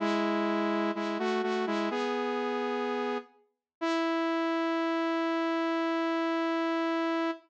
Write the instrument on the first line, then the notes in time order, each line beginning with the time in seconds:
lead 2 (sawtooth)
0.00 G#3 E4
0.95 G#3 E4
1.19 A3 F#4
1.43 A3 F#4
1.67 G#3 E4
1.90 B3 G#4
3.81 E4